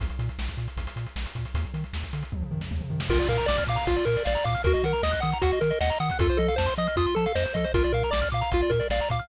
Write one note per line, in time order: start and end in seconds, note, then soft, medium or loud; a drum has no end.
0.00 0.10 A#1 medium
0.00 kick medium
0.00 closed hi-hat medium
0.10 closed hi-hat medium
0.19 0.30 A#2 medium
0.19 closed hi-hat medium
0.29 closed hi-hat medium
0.39 0.49 A#1 medium
0.39 snare medium
0.48 kick medium
0.48 closed hi-hat medium
0.57 0.68 A#2 medium
0.57 closed hi-hat medium
0.68 closed hi-hat medium
0.77 0.87 A#1 medium
0.77 kick medium
0.77 closed hi-hat medium
0.87 closed hi-hat medium
0.96 1.07 A#2 medium
0.96 closed hi-hat medium
1.06 closed hi-hat medium
1.16 1.26 A#1 medium
1.16 snare medium
1.26 closed hi-hat medium
1.35 1.46 A#2 medium
1.35 kick medium
1.35 closed hi-hat medium
1.45 closed hi-hat medium
1.54 1.65 D#2 loud
1.54 kick medium
1.54 closed hi-hat medium
1.65 closed hi-hat medium
1.74 1.84 D#3 medium
1.74 closed hi-hat medium
1.84 closed hi-hat soft
1.93 2.04 D#2 medium
1.93 snare medium
2.03 kick medium
2.03 closed hi-hat medium
2.13 2.24 D3 medium
2.13 closed hi-hat medium
2.23 closed hi-hat medium
2.32 2.43 D#2 medium
2.32 kick medium
2.32 high tom medium
2.42 mid tom medium
2.51 2.62 D#3 medium
2.51 floor tom medium
2.61 snare medium
2.71 2.82 D#2 medium
2.71 high tom medium
2.81 mid tom medium
2.90 3.01 D#3 medium
2.90 floor tom medium
3.00 snare medium
3.09 3.20 A#1 medium
3.09 3.28 F4 medium
3.09 3.18 A#4 medium
3.09 kick medium
3.09 crash medium
3.19 3.28 D5 medium
3.19 closed hi-hat medium
3.29 3.39 A#2 medium
3.29 3.47 A#4 medium
3.29 3.37 F5 medium
3.29 closed hi-hat medium
3.38 3.46 A#5 medium
3.38 closed hi-hat medium
3.46 3.59 A#1 medium
3.46 3.64 D5 medium
3.46 3.57 D6 medium
3.46 snare loud
3.58 3.67 F6 medium
3.58 kick medium
3.58 closed hi-hat medium
3.67 3.78 A#2 medium
3.67 3.87 F5 medium
3.67 3.77 D6 medium
3.67 closed hi-hat medium
3.76 3.85 A#5 medium
3.76 closed hi-hat medium
3.87 3.98 A#1 medium
3.87 4.05 F4 medium
3.87 3.96 F5 medium
3.87 kick medium
3.87 closed hi-hat medium
3.96 4.05 D5 medium
3.96 closed hi-hat medium
4.05 4.17 A#2 medium
4.05 4.23 A#4 medium
4.05 4.16 A#4 medium
4.05 closed hi-hat medium
4.16 4.26 D5 medium
4.16 closed hi-hat medium
4.25 4.37 A#1 medium
4.25 4.45 D5 medium
4.25 4.34 F5 medium
4.25 snare medium
4.35 4.44 A#5 medium
4.35 closed hi-hat medium
4.44 4.56 A#2 medium
4.44 4.62 F5 medium
4.44 4.54 D6 medium
4.44 kick medium
4.44 closed hi-hat medium
4.55 4.63 F6 medium
4.55 closed hi-hat medium
4.64 4.75 D#2 medium
4.64 4.85 F#4 medium
4.64 4.73 A#4 loud
4.64 kick medium
4.64 closed hi-hat medium
4.74 4.82 D#5 medium
4.74 closed hi-hat medium
4.83 4.94 D#3 medium
4.83 5.03 A#4 medium
4.83 4.93 F#5 medium
4.83 closed hi-hat medium
4.93 5.02 A#5 medium
4.93 closed hi-hat medium
5.03 5.14 D#2 medium
5.03 5.21 D#5 medium
5.03 5.12 D#6 medium
5.03 snare medium
5.11 5.20 F#6 medium
5.11 kick medium
5.11 closed hi-hat medium
5.20 5.34 D#3 medium
5.20 5.38 F#5 medium
5.20 5.31 D#6 medium
5.20 closed hi-hat medium
5.32 5.42 A#5 medium
5.32 closed hi-hat medium
5.42 5.53 D#2 medium
5.42 5.59 F#4 medium
5.42 5.51 F#5 medium
5.42 kick medium
5.42 closed hi-hat loud
5.52 5.62 D#5 medium
5.52 closed hi-hat medium
5.61 5.72 D#3 medium
5.61 5.79 A#4 medium
5.61 5.70 A#4 medium
5.61 closed hi-hat medium
5.70 5.79 D#5 medium
5.70 closed hi-hat medium
5.80 5.91 D#2 medium
5.80 5.98 D#5 medium
5.80 5.90 F#5 medium
5.80 snare medium
5.90 5.99 A#5 medium
5.90 closed hi-hat medium
6.00 6.11 D#3 medium
6.00 6.18 F#5 medium
6.00 6.09 D#6 medium
6.00 closed hi-hat medium
6.10 6.20 F#6 medium
6.10 kick medium
6.10 closed hi-hat medium
6.19 6.30 F2 medium
6.19 6.38 F4 medium
6.19 6.28 A4 medium
6.19 kick loud
6.19 closed hi-hat loud
6.29 6.38 C5 medium
6.29 closed hi-hat medium
6.37 6.50 F3 medium
6.37 6.55 A4 medium
6.37 6.47 D#5 medium
6.37 closed hi-hat medium
6.48 6.57 F5 medium
6.48 closed hi-hat medium
6.56 6.69 F2 medium
6.56 6.74 C5 medium
6.56 6.67 A5 medium
6.56 snare loud
6.66 6.75 C6 medium
6.66 closed hi-hat medium
6.77 6.88 F3 medium
6.77 6.96 D#5 medium
6.77 6.87 D#6 medium
6.77 closed hi-hat medium
6.87 6.96 F6 medium
6.87 closed hi-hat medium
6.96 7.07 F2 medium
6.96 7.15 F4 medium
6.96 7.06 D#6 medium
6.96 kick medium
6.96 closed hi-hat medium
7.06 7.15 C6 medium
7.06 closed hi-hat medium
7.15 7.27 F3 medium
7.15 7.33 A4 medium
7.15 7.25 A5 medium
7.15 closed hi-hat medium
7.26 7.35 F5 medium
7.26 closed hi-hat medium
7.35 7.46 F2 medium
7.35 7.53 C5 medium
7.35 7.44 D#5 medium
7.35 snare medium
7.45 7.55 C5 medium
7.45 closed hi-hat medium
7.54 7.66 F3 medium
7.54 7.65 A4 medium
7.54 7.72 D#5 medium
7.54 kick medium
7.54 closed hi-hat medium
7.64 7.73 C5 medium
7.64 closed hi-hat medium
7.74 7.85 A#1 medium
7.74 7.92 F4 medium
7.74 7.83 A#4 medium
7.74 kick loud
7.74 closed hi-hat medium
7.84 7.93 D5 medium
7.84 closed hi-hat medium
7.92 8.04 A#2 medium
7.92 8.10 A#4 medium
7.92 8.03 F5 medium
7.92 closed hi-hat medium
8.03 8.13 A#5 medium
8.03 closed hi-hat medium
8.11 8.23 A#1 medium
8.11 8.29 D5 medium
8.11 8.20 D6 medium
8.11 snare loud
8.22 8.30 F6 medium
8.22 kick medium
8.22 closed hi-hat medium
8.32 8.43 A#2 medium
8.32 8.52 F5 medium
8.32 8.40 D6 medium
8.32 closed hi-hat medium
8.41 8.50 A#5 medium
8.41 closed hi-hat medium
8.52 8.63 A#1 medium
8.52 8.72 F4 medium
8.52 8.61 F5 medium
8.52 kick medium
8.52 closed hi-hat medium
8.61 8.71 D5 medium
8.61 closed hi-hat medium
8.70 8.81 A#2 medium
8.70 8.88 A#4 medium
8.70 8.79 A#4 medium
8.70 kick medium
8.70 closed hi-hat medium
8.80 8.88 D5 medium
8.80 closed hi-hat medium
8.90 9.01 A#1 medium
8.90 9.09 D5 medium
8.90 9.00 F5 medium
8.90 snare medium
9.00 9.10 A#5 medium
9.00 closed hi-hat medium
9.10 9.21 A#2 medium
9.10 9.28 F5 medium
9.10 9.20 D6 medium
9.10 kick medium
9.10 closed hi-hat medium
9.19 9.28 F6 medium
9.19 closed hi-hat medium